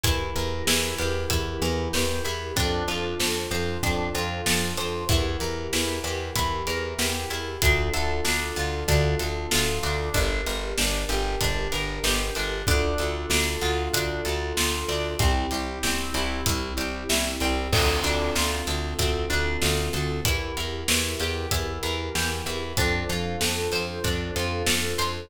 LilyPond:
<<
  \new Staff \with { instrumentName = "Drawbar Organ" } { \time 4/4 \key d \minor \tempo 4 = 95 <e' g' bes'>1 | <d' f' a' c''>1 | <e' g' bes'>1 | <d' f' a'>1 |
<d' g' bes'>1 | <d' f' a'>1 | <c' e' g'>1 | <c' d' f' a'>1 |
<e' g' bes'>1 | <d' f' a' c''>1 | }
  \new Staff \with { instrumentName = "Acoustic Guitar (steel)" } { \time 4/4 \key d \minor e'8 bes'8 e'8 g'8 e'8 bes'8 g'8 e'8 | d'8 f'8 a'8 c''8 d'8 f'8 a'8 c''8 | e'8 bes'8 e'8 g'8 e'8 bes'8 g'8 e'8 | d'8 a'8 d'8 f'8 d'8 a'8 f'8 d'8 |
d'8 bes'8 d'8 g'8 d'8 bes'8 g'8 d'8 | d'8 a'8 d'8 f'8 d'8 a'8 f'8 d'8 | c'8 g'8 c'8 e'8 c'8 g'8 e'8 c'8 | c'8 d'8 f'8 a'8 c'8 d'8 f'8 a'8 |
e'8 bes'8 e'8 g'8 e'8 bes'8 g'8 e'8 | d'8 f'8 a'8 c''8 d'8 f'8 a'8 c''8 | }
  \new Staff \with { instrumentName = "Electric Bass (finger)" } { \clef bass \time 4/4 \key d \minor e,8 e,8 e,8 e,8 e,8 e,8 e,8 e,8 | f,8 f,8 f,8 f,8 f,8 f,8 f,8 f,8 | e,8 e,8 e,8 e,8 e,8 e,8 e,8 e,8 | d,8 d,8 d,8 d,8 d,8 d,8 d,8 d,8 |
g,,8 g,,8 g,,8 g,,8 g,,8 g,,8 g,,8 g,,8 | d,8 d,8 d,8 d,8 d,8 d,8 d,8 d,8 | c,8 c,8 c,8 c,8 c,8 c,8 c,8 c,8 | d,8 d,8 d,8 d,8 d,8 d,8 d,8 d,8 |
e,8 e,8 e,8 e,8 e,8 e,8 e,8 e,8 | f,8 f,8 f,8 f,8 f,8 f,8 f,8 f,8 | }
  \new DrumStaff \with { instrumentName = "Drums" } \drummode { \time 4/4 <hh bd>8 hh8 sn8 hh8 <hh bd>8 hh8 sn8 hh8 | <hh bd>8 hh8 sn8 hh8 <hh bd>8 hh8 sn8 hh8 | <hh bd>8 hh8 sn8 hh8 <hh bd>8 hh8 sn8 hh8 | <hh bd>8 hh8 sn8 hh8 <hh bd>8 hh8 sn8 hh8 |
<hh bd>8 hh8 sn8 hh8 <hh bd>8 hh8 sn8 hh8 | <hh bd>8 hh8 sn8 hh8 <hh bd>8 hh8 sn8 hh8 | <hh bd>8 hh8 sn8 hh8 <hh bd>8 hh8 sn8 hh8 | <cymc bd>8 hh8 sn8 hh8 <hh bd>8 hh8 sn8 hh8 |
<hh bd>8 hh8 sn8 hh8 <hh bd>8 hh8 sn8 hh8 | <hh bd>8 hh8 sn8 hh8 <hh bd>8 hh8 sn8 hh8 | }
>>